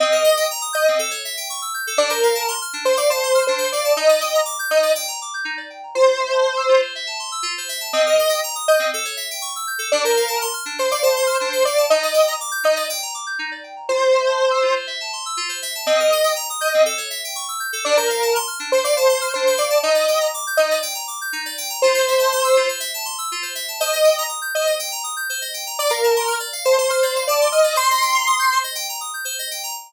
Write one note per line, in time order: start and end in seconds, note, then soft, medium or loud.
0.00 0.11 C4 loud
0.00 0.46 D#5 loud
0.12 0.23 A#4 medium
0.24 0.35 D#5 medium
0.37 0.48 G5 medium
0.51 0.62 A#5 medium
0.61 0.73 D#6 medium
0.73 0.98 D#5 loud
0.73 0.84 G6 medium
0.88 0.99 C4 medium
0.99 1.10 A4 loud
1.11 1.22 C#5 medium
1.25 1.36 E5 medium
1.37 1.48 G5 medium
1.50 1.61 C#6 medium
1.62 1.73 E6 medium
1.74 1.85 G6 medium
1.87 1.98 A4 medium
1.97 2.09 D4 loud
1.97 2.10 D5 loud
2.10 2.52 A#4 medium
2.10 2.21 C5 medium
2.23 2.34 F5 medium
2.35 2.46 A5 medium
2.48 2.59 C6 medium
2.62 2.73 F6 medium
2.73 2.85 D4 medium
2.85 2.96 C5 medium
2.85 2.97 C5 loud
2.97 3.09 D5 medium
2.97 3.08 F5 medium
3.10 3.45 C5 loud
3.10 3.22 A5 medium
3.23 3.34 C6 medium
3.35 3.46 F6 medium
3.47 3.59 D4 medium
3.47 3.71 C5 medium
3.58 3.69 C5 medium
3.72 3.92 D5 loud
3.72 3.84 F5 medium
3.85 3.96 A5 medium
3.96 4.08 D#4 loud
3.96 4.41 D#5 loud
4.09 4.20 D5 medium
4.21 4.32 G5 medium
4.34 4.46 A#5 medium
4.45 4.56 D6 medium
4.59 4.70 G6 medium
4.70 4.82 D#4 medium
4.70 4.92 D#5 loud
4.83 4.94 D5 medium
4.95 5.07 G5 medium
5.08 5.19 A#5 medium
5.22 5.33 D6 medium
5.34 5.45 G6 medium
5.45 5.56 D#4 medium
5.57 5.68 D5 medium
5.70 5.81 G5 medium
5.83 5.95 A#5 medium
5.95 6.06 F4 medium
5.95 6.81 C5 loud
6.07 6.18 C5 medium
6.20 6.31 E5 medium
6.32 6.43 A5 medium
6.45 6.56 C6 medium
6.57 6.68 E6 medium
6.69 6.80 F4 medium
6.82 6.93 C5 medium
6.95 7.06 E5 medium
7.07 7.18 A5 medium
7.19 7.30 C6 medium
7.32 7.43 E6 medium
7.43 7.54 F4 medium
7.58 7.69 C5 medium
7.69 7.80 E5 medium
7.80 7.92 A5 medium
7.93 8.04 C4 loud
7.93 8.40 D#5 loud
8.06 8.18 A#4 medium
8.19 8.30 D#5 medium
8.29 8.40 G5 medium
8.43 8.55 A#5 medium
8.55 8.66 D#6 medium
8.68 8.91 D#5 loud
8.68 8.79 G6 medium
8.79 8.90 C4 medium
8.93 9.05 A4 loud
9.05 9.16 C#5 medium
9.17 9.28 E5 medium
9.31 9.42 G5 medium
9.42 9.53 C#6 medium
9.56 9.67 E6 medium
9.67 9.78 G6 medium
9.79 9.90 A4 medium
9.92 10.03 D4 loud
9.92 10.04 D5 loud
10.04 10.46 A#4 medium
10.04 10.16 C5 medium
10.17 10.28 F5 medium
10.28 10.39 A5 medium
10.41 10.52 C6 medium
10.53 10.64 F6 medium
10.65 10.77 D4 medium
10.78 10.89 C5 medium
10.78 10.91 C5 loud
10.91 11.03 D5 medium
10.91 11.02 F5 medium
11.03 11.38 C5 loud
11.03 11.14 A5 medium
11.16 11.28 C6 medium
11.27 11.38 F6 medium
11.40 11.52 D4 medium
11.40 11.63 C5 medium
11.53 11.64 C5 medium
11.65 11.85 D5 loud
11.65 11.77 F5 medium
11.77 11.89 A5 medium
11.90 12.02 D#4 loud
11.90 12.34 D#5 loud
12.03 12.14 D5 medium
12.14 12.25 G5 medium
12.27 12.38 A#5 medium
12.40 12.52 D6 medium
12.51 12.63 G6 medium
12.64 12.75 D#4 medium
12.64 12.86 D#5 loud
12.76 12.88 D5 medium
12.89 13.01 G5 medium
13.02 13.14 A#5 medium
13.14 13.26 D6 medium
13.27 13.38 G6 medium
13.39 13.50 D#4 medium
13.51 13.63 D5 medium
13.64 13.75 G5 medium
13.76 13.88 A#5 medium
13.89 14.00 F4 medium
13.89 14.75 C5 loud
14.01 14.12 C5 medium
14.12 14.24 E5 medium
14.27 14.38 A5 medium
14.38 14.50 C6 medium
14.51 14.62 E6 medium
14.63 14.74 F4 medium
14.76 14.87 C5 medium
14.87 14.98 E5 medium
15.00 15.12 A5 medium
15.13 15.24 C6 medium
15.26 15.37 E6 medium
15.37 15.48 F4 medium
15.49 15.60 C5 medium
15.62 15.73 E5 medium
15.75 15.86 A5 medium
15.86 15.97 C4 loud
15.86 16.33 D#5 loud
16.00 16.11 A#4 medium
16.12 16.23 D#5 medium
16.24 16.35 G5 medium
16.36 16.47 A#5 medium
16.50 16.61 D#6 medium
16.61 16.84 D#5 loud
16.61 16.72 G6 medium
16.74 16.85 C4 medium
16.86 16.97 A4 loud
16.98 17.09 C#5 medium
17.10 17.21 E5 medium
17.24 17.36 G5 medium
17.35 17.47 C#6 medium
17.48 17.60 E6 medium
17.60 17.71 G6 medium
17.73 17.84 A4 medium
17.85 17.96 D4 loud
17.85 17.96 D5 loud
17.97 18.39 A#4 medium
17.97 18.08 C5 medium
18.10 18.21 F5 medium
18.22 18.33 A5 medium
18.35 18.46 C6 medium
18.47 18.59 F6 medium
18.60 18.71 D4 medium
18.72 18.84 C5 loud
18.72 18.84 C5 medium
18.84 18.96 D5 medium
18.84 18.95 F5 medium
18.97 19.32 C5 loud
18.97 19.08 A5 medium
19.09 19.20 C6 medium
19.21 19.32 F6 medium
19.34 19.46 D4 medium
19.34 19.57 C5 medium
19.47 19.58 C5 medium
19.57 19.78 D5 loud
19.57 19.68 F5 medium
19.70 19.81 A5 medium
19.83 19.94 D#4 loud
19.83 20.27 D#5 loud
19.95 20.06 D5 medium
20.08 20.19 G5 medium
20.21 20.32 A#5 medium
20.34 20.45 D6 medium
20.47 20.58 G6 medium
20.57 20.69 D#4 medium
20.57 20.78 D#5 loud
20.71 20.82 D5 medium
20.82 20.94 G5 medium
20.95 21.06 A#5 medium
21.07 21.19 D6 medium
21.21 21.33 G6 medium
21.33 21.44 D#4 medium
21.46 21.57 D5 medium
21.58 21.69 G5 medium
21.70 21.81 A#5 medium
21.82 21.94 F4 medium
21.82 22.68 C5 loud
21.94 22.05 C5 medium
22.08 22.19 E5 medium
22.19 22.30 A5 medium
22.32 22.43 C6 medium
22.44 22.55 E6 medium
22.56 22.68 F4 medium
22.69 22.80 C5 medium
22.80 22.91 E5 medium
22.94 23.05 A5 medium
23.05 23.16 C6 medium
23.18 23.29 E6 medium
23.32 23.43 F4 medium
23.42 23.54 C5 medium
23.55 23.66 E5 medium
23.68 23.79 A5 medium
23.80 23.91 C5 loud
23.80 24.23 D#5 loud
23.93 24.04 D#5 medium
24.04 24.15 G5 medium
24.18 24.29 A#5 medium
24.29 24.40 D#6 medium
24.42 24.53 G6 medium
24.55 24.66 C5 medium
24.55 24.75 D#5 medium
24.66 24.77 D#5 medium
24.79 24.90 G5 medium
24.92 25.03 A#5 medium
25.04 25.15 D#6 medium
25.16 25.28 G6 medium
25.29 25.41 C5 medium
25.41 25.53 D#5 medium
25.54 25.65 G5 medium
25.67 25.78 A#5 medium
25.79 25.91 D5 loud
25.79 25.90 D5 medium
25.89 26.38 A#4 medium
25.89 26.01 F5 medium
26.03 26.15 A5 medium
26.16 26.27 C6 medium
26.27 26.38 F6 medium
26.40 26.51 D5 medium
26.53 26.64 F5 medium
26.65 26.77 C5 loud
26.65 26.76 A5 medium
26.78 26.90 C5 loud
26.78 26.89 C6 medium
26.90 27.24 C5 medium
26.90 27.01 F6 medium
27.02 27.14 D5 medium
27.16 27.27 F5 medium
27.27 27.48 D5 loud
27.27 27.39 A5 medium
27.41 27.52 C6 medium
27.52 27.76 D#5 loud
27.52 27.63 F6 medium
27.64 27.75 D5 medium
27.76 27.87 C5 loud
27.76 28.58 C6 loud
27.90 28.02 D#5 medium
28.02 28.13 G5 medium
28.14 28.25 A#5 medium
28.27 28.38 D#6 medium
28.39 28.50 G6 medium
28.52 28.64 C5 medium
28.64 28.75 D#5 medium
28.75 28.86 G5 medium
28.89 29.00 A#5 medium
29.01 29.12 D#6 medium
29.14 29.25 G6 medium
29.25 29.36 C5 medium
29.39 29.50 D#5 medium
29.51 29.62 G5 medium
29.63 29.74 A#5 medium